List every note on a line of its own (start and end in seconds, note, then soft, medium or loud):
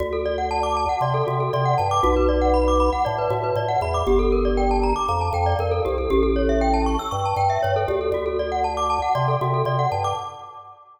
0.00 0.86 D2 medium
0.00 0.11 F#4 medium
0.13 0.24 A4 medium
0.25 0.37 D5 medium
0.38 0.49 F#5 medium
0.51 0.62 A5 medium
0.63 0.74 D6 medium
0.77 0.88 A5 medium
0.89 1.00 F#5 medium
1.01 1.22 C3 medium
1.01 1.13 D5 medium
1.14 1.25 A4 medium
1.27 1.49 C3 medium
1.27 1.38 F#4 medium
1.40 1.51 A4 medium
1.53 1.75 C3 medium
1.53 1.65 D5 medium
1.65 1.77 F#5 medium
1.78 2.01 G2 medium
1.78 1.89 A5 medium
1.91 2.02 D6 medium
2.03 2.90 B1 medium
2.03 2.15 F#4 medium
2.16 2.28 B4 medium
2.29 2.40 D5 medium
2.41 2.53 F#5 medium
2.54 2.65 B5 medium
2.68 2.79 D6 medium
2.80 2.91 B5 medium
2.92 3.04 F#5 medium
3.05 3.28 A2 medium
3.05 3.16 D5 medium
3.18 3.30 B4 medium
3.30 3.52 A2 medium
3.30 3.42 F#4 medium
3.43 3.55 B4 medium
3.56 3.77 A2 medium
3.56 3.68 D5 medium
3.68 3.80 F#5 medium
3.81 4.03 E2 medium
3.81 3.94 B5 medium
3.94 4.06 D6 medium
4.07 4.93 G1 medium
4.07 4.19 G4 medium
4.19 4.30 A4 medium
4.32 4.44 A#4 medium
4.45 4.56 D5 medium
4.57 4.69 G5 medium
4.71 4.82 A5 medium
4.83 4.95 A#5 medium
4.96 5.07 D6 medium
5.08 5.30 F2 medium
5.08 5.20 A#5 medium
5.21 5.32 A5 medium
5.33 5.54 F2 medium
5.33 5.45 G5 medium
5.46 5.58 D5 medium
5.59 5.80 F2 medium
5.59 5.71 A#4 medium
5.71 5.83 A4 medium
5.85 6.07 C2 medium
5.85 5.96 G4 medium
5.98 6.09 A4 medium
6.10 6.97 A1 medium
6.10 6.22 G4 loud
6.23 6.34 A4 medium
6.36 6.47 C#5 medium
6.49 6.60 E5 medium
6.61 6.73 G5 medium
6.74 6.85 A5 medium
6.86 6.98 C#6 medium
6.99 7.11 E6 medium
7.11 7.34 G2 medium
7.11 7.23 C#6 medium
7.25 7.37 A5 medium
7.36 7.58 G2 medium
7.36 7.48 G5 medium
7.50 7.61 E5 medium
7.63 7.86 G2 medium
7.63 7.74 C#5 medium
7.76 7.87 A4 medium
7.88 8.10 D2 medium
7.88 7.99 G4 medium
8.01 8.12 A4 medium
8.12 8.99 D2 medium
8.12 8.25 F#4 medium
8.26 8.37 A4 medium
8.39 8.51 D5 medium
8.52 8.63 F#5 medium
8.64 8.76 A5 medium
8.77 8.88 D6 medium
8.90 9.01 A5 medium
9.02 9.14 F#5 medium
9.15 9.37 C3 medium
9.15 9.26 D5 medium
9.28 9.39 A4 medium
9.41 9.63 C3 medium
9.41 9.53 F#4 medium
9.54 9.65 A4 medium
9.65 9.87 C3 medium
9.65 9.77 D5 medium
9.79 9.90 F#5 medium
9.92 10.13 G2 medium
9.92 10.03 A5 medium
10.04 10.16 D6 medium